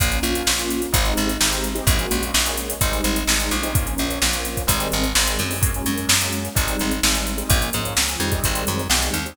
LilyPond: <<
  \new Staff \with { instrumentName = "Acoustic Grand Piano" } { \time 4/4 \key bes \minor \tempo 4 = 128 <bes des' f'>16 <bes des' f'>16 <bes des' f'>8. <bes des' f'>8. <aes c' ees' g'>4 <aes c' ees' g'>8. <aes c' ees' g'>16 | <aes bes des' ges'>16 <aes bes des' ges'>16 <aes bes des' ges'>8. <aes bes des' ges'>8. <g aes c' ees'>4 <g aes c' ees'>8. <g aes c' ees'>16 | <f bes des'>16 <f bes des'>16 <f bes des'>8. <f bes des'>8. <ees g aes c'>4 <ees g aes c'>8. <ees g aes c'>16 | <ges aes bes des'>16 <ges aes bes des'>16 <ges aes bes des'>8. <ges aes bes des'>8. <g aes c' ees'>4 <g aes c' ees'>8. <g aes c' ees'>16 |
<f bes des'>16 <f bes des'>16 <f bes des'>8. <f bes des'>16 <ees g aes c'>4. <ees g aes c'>8. <ees g aes c'>16 | }
  \new Staff \with { instrumentName = "Electric Bass (finger)" } { \clef bass \time 4/4 \key bes \minor bes,,8 bes,,8 bes,,4 aes,,8 aes,,8 aes,,4 | bes,,8 bes,,8 bes,,4 aes,,8 aes,,8 aes,,8 bes,,8~ | bes,,8 bes,,8 bes,,4 aes,,8 aes,,8 aes,,8 ges,8~ | ges,8 ges,8 ges,4 aes,,8 aes,,8 aes,,4 |
bes,,8 aes,8 des,8 f,8 aes,,8 ges,8 b,,8 ees,8 | }
  \new DrumStaff \with { instrumentName = "Drums" } \drummode { \time 4/4 <hh bd>16 hh16 hh16 hh16 sn16 hh16 hh16 hh16 <hh bd>16 hh16 hh16 hh16 sn16 hh16 hh16 hh16 | <hh bd>16 hh16 hh16 hh16 sn16 hh16 hh16 hh16 <hh bd>16 hh16 hh16 hh16 sn16 hh16 hh16 hh16 | <hh bd>16 hh16 hh16 hh16 sn16 hh16 hh16 <hh bd>16 <hh bd>16 hh16 hh16 hh16 sn16 hh16 hh16 hho16 | <hh bd>16 hh16 hh16 hh16 sn16 hh16 hh16 hh16 <hh bd>16 hh16 hh16 hh16 sn16 hh16 hh16 hh16 |
<hh bd>16 hh16 hh16 hh16 sn16 hh16 hh16 <hh bd>16 <hh bd>16 hh16 hh16 hh16 sn16 hh16 hh16 hh16 | }
>>